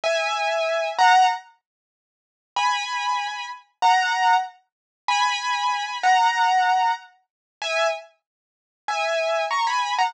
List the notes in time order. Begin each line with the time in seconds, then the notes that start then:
0.04 E5 G#5
0.98 F#5 A#5
2.56 G#5 B5
3.82 F#5 A#5
5.08 G#5 B5
6.03 F#5 A#5
7.62 E5 G#5
8.88 E5 G#5
9.51 A#5 C#6
9.67 G#5 B5
9.98 F#5 A#5